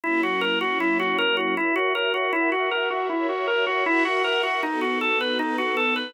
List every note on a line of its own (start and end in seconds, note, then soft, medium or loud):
0.04 1.55 F#3 medium
0.04 1.55 A#3 medium
0.04 1.55 C#4 medium
0.04 1.55 E4 medium
0.04 0.21 E4 medium
0.23 0.41 F#4 medium
0.41 0.59 A#4 medium
0.61 0.78 F#4 medium
0.80 0.98 E4 medium
1.00 1.17 F#4 medium
1.18 1.36 A#4 medium
1.37 1.55 F#4 medium
1.57 1.75 E4 medium
1.57 2.32 F#4 medium
1.57 2.32 A#4 medium
1.57 2.32 C#5 medium
1.57 2.32 E5 medium
1.76 1.93 F#4 medium
1.95 2.13 A#4 medium
2.14 2.32 F#4 medium
2.33 2.50 E4 medium
2.33 3.09 F#4 medium
2.33 3.09 A#4 medium
2.33 3.09 E5 medium
2.33 3.09 F#5 medium
2.52 2.70 F#4 medium
2.71 2.89 A#4 medium
2.90 3.08 F#4 medium
3.09 3.27 E4 medium
3.09 3.85 F#4 medium
3.09 3.85 A#4 medium
3.09 3.85 C#5 medium
3.09 3.85 E5 medium
3.29 3.46 F#4 medium
3.47 3.65 A#4 medium
3.67 3.84 F#4 medium
3.86 4.04 E4 medium
3.86 4.62 F#4 medium
3.86 4.62 A#4 medium
3.86 4.62 E5 medium
3.86 4.62 F#5 medium
4.05 4.23 F#4 medium
4.24 4.42 A#4 medium
4.43 4.61 F#4 medium
4.63 5.38 B3 medium
4.63 5.38 D#4 medium
4.63 4.80 D#4 medium
4.63 5.38 F#4 medium
4.63 5.38 A4 medium
4.81 4.99 F#4 medium
5.01 5.19 A4 medium
5.21 5.38 B4 medium
5.39 6.14 B3 medium
5.39 6.14 D#4 medium
5.39 5.57 D#4 medium
5.39 6.14 A4 medium
5.39 6.14 B4 medium
5.58 5.76 F#4 medium
5.77 5.94 A4 medium
5.96 6.13 B4 medium